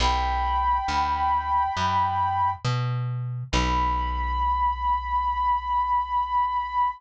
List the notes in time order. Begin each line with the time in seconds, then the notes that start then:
0.00 B1 G5 B5
0.88 D2
1.77 F#2
2.65 B2
3.52 B1 B5